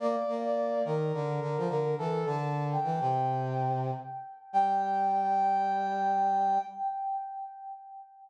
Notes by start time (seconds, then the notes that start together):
0.00 A#3 D5
0.28 A#3
0.45 D5
0.85 D#3 A#4
1.14 D3
1.41 D3
1.58 F3
1.69 D3 A#4
1.98 E3 A4
2.25 D3 A5
2.72 G5
2.84 E3
3.00 C3
4.53 G3 G5